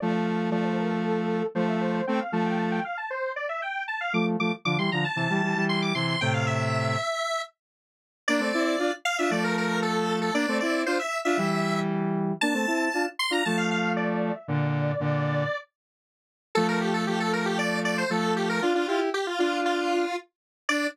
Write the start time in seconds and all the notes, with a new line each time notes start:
0.00 F3 A3 D5
0.26 F5
0.50 F3 A3 D5
0.65 C5
0.77 A#4
0.91 A4
1.04 A4
1.55 F3 A3 C5
1.68 E5
1.81 C5
1.94 C5
2.07 A3 C4 G5
2.20 F5
2.32 F3 A3 A5
2.46 G5
2.59 A5
2.72 G5
2.84 F5
2.97 A5
3.10 C5
3.36 D5
3.49 E5
3.62 G5
3.88 A5
4.01 F5
4.13 F3 A3 D6
4.40 F3 A3 D6
4.65 D3 F3 D6
4.78 E3 G3 C6
4.92 D3 F3 A#5
5.04 A5
5.16 C3 E3 A5
5.30 E3 G3
5.42 E3 G3
5.55 E3 G3
5.69 C6
5.82 D6
5.94 C3 E3 C6
6.08 C6
6.21 A2 C3 G5
6.34 F5
6.47 E5
8.28 A#3 D4 D5
8.40 A3 C4
8.54 C4 E4
8.79 D4 F4
9.05 F5
9.18 D4 F4 E5
9.30 F3 A3 D5
9.44 A#4
9.57 A#4
9.82 A4
10.21 A4
10.34 A#3 D4 D5
10.48 A3 C4
10.60 C4 E4 D5
10.86 D4 F4 C5
10.99 E5
11.25 D4 F4 E5
11.37 E3 G3
12.41 A#3 D4 A5
12.54 A3 C4
12.67 C4 E4
12.94 D4 F4
13.19 C6
13.30 D4 F4 A#5
13.45 F3 A3 A5
13.57 F5
13.71 F5
13.97 D5
14.35 E5
14.48 A#2 D3 D5
15.00 A#2 D3
16.55 F3 A3 A4
16.68 A#4
16.81 G4
16.94 A4
17.07 F3 A3 G4
17.20 A4
17.33 A#4
17.45 G4
17.58 D5
17.85 D5
17.98 C5
18.10 F3 A3 A4
18.36 G4
18.49 A#4
18.62 D4 F4
18.74 D4 F4
18.87 E4 F4 G4
19.14 G4
19.27 F4
19.39 D4 F4
19.65 F4
20.69 D4 D5